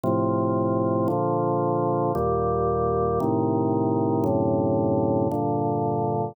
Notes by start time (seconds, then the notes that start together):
0.04 A2 C3 F3
1.08 A#2 D3 F3
2.15 D#2 A#2 G3
3.20 A2 C3 D#3
4.24 F#2 A2 C3 D3
5.31 G2 A#2 D3